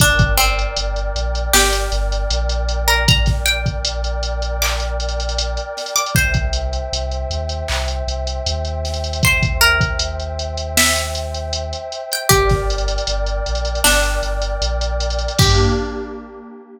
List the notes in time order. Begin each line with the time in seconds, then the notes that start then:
0.00 G1 D4 A#4 D5 G5, kick, closed hi-hat
0.19 kick, closed hi-hat
0.38 C4, closed hi-hat
0.59 closed hi-hat
0.76 G1, closed hi-hat
0.96 closed hi-hat
1.16 A#1, closed hi-hat
1.35 closed hi-hat
1.53 G1 G4, snare
1.73 closed hi-hat
1.92 G1, closed hi-hat
2.12 closed hi-hat
2.30 A#1, closed hi-hat
2.49 closed hi-hat
2.69 closed hi-hat
2.88 A#4, closed hi-hat
3.08 A#5, kick, closed hi-hat
3.26 kick, snare, closed hi-hat
3.46 G5, closed hi-hat
3.66 kick, closed hi-hat
3.85 closed hi-hat
4.04 closed hi-hat
4.23 closed hi-hat
4.42 closed hi-hat
4.62 D6, clap
4.80 closed hi-hat
5.00 closed hi-hat
5.09 closed hi-hat
5.20 closed hi-hat
5.29 closed hi-hat
5.38 closed hi-hat
5.57 closed hi-hat
5.77 snare, closed hi-hat
5.86 closed hi-hat
5.96 D6, closed hi-hat
6.06 closed hi-hat
6.15 C2 C5 E5 G5, kick, closed hi-hat
6.34 kick, closed hi-hat
6.53 closed hi-hat
6.73 closed hi-hat
6.93 C2, closed hi-hat
7.11 closed hi-hat
7.30 D#2, closed hi-hat
7.49 closed hi-hat
7.68 C2, clap
7.88 closed hi-hat
8.07 C2, closed hi-hat
8.27 closed hi-hat
8.46 D#2, closed hi-hat
8.65 closed hi-hat
8.85 snare, closed hi-hat
8.94 closed hi-hat
9.04 closed hi-hat
9.13 closed hi-hat
9.23 C5, kick, closed hi-hat
9.43 kick, closed hi-hat
9.61 A#4, closed hi-hat
9.81 kick, closed hi-hat
9.99 closed hi-hat
10.20 closed hi-hat
10.39 closed hi-hat
10.57 closed hi-hat
10.77 E5, snare
10.96 closed hi-hat
11.15 closed hi-hat
11.34 closed hi-hat
11.53 closed hi-hat
11.73 closed hi-hat
11.92 closed hi-hat
12.12 G5, closed hi-hat
12.29 G1 G4 A#4 D5 G5, kick, closed hi-hat
12.49 kick, snare, closed hi-hat
12.70 closed hi-hat
12.78 closed hi-hat
12.88 closed hi-hat
12.98 closed hi-hat
13.07 G1, closed hi-hat
13.26 closed hi-hat
13.46 A#1, closed hi-hat
13.55 closed hi-hat
13.65 closed hi-hat
13.75 closed hi-hat
13.84 G1 D4, snare
14.03 closed hi-hat
14.23 G1, closed hi-hat
14.42 closed hi-hat
14.62 A#1, closed hi-hat
14.81 closed hi-hat
15.00 closed hi-hat
15.10 closed hi-hat
15.19 closed hi-hat
15.28 closed hi-hat
15.38 G2 A#3 D4 G4, kick, crash